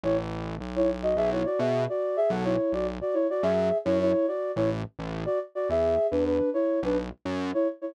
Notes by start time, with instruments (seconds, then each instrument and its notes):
0.04 synth bass 1 A1, flute E4 C#5
0.60 synth bass 1 B1
0.76 flute E4 C#5
1.03 flute F#4 D#5
1.17 synth bass 1 B1, flute G#4 E5
1.32 flute E4 C#5
1.46 flute F#4 D5
1.59 synth bass 1 B2, flute G#4 E5
1.89 flute F#4 D5
2.17 flute G#4 E5
2.30 synth bass 1 B1, flute A4 F#5
2.44 flute E4 C#5
2.73 synth bass 1 B1, flute F#4 D5
3.01 flute F#4 D5
3.14 flute E4 C#5
3.30 flute F#4 D5
3.43 synth bass 1 F#2, flute G#4 E5
3.85 synth bass 1 F#2, flute E4 C#5
4.01 flute E4 C#5
4.28 flute F#4 D5
4.56 synth bass 1 A1, flute E4 C#5
4.99 synth bass 1 A1
5.26 flute F#4 D5
5.55 flute F#4 D5
5.69 synth bass 1 E2, flute G#4 E5
6.11 synth bass 1 E2, flute D4 B4
6.25 flute D4 B4
6.54 flute E4 C#5
6.83 synth bass 1 B1, flute D4 B4
7.25 synth bass 1 F#2
7.54 flute E4 C#5
7.81 flute E4 C#5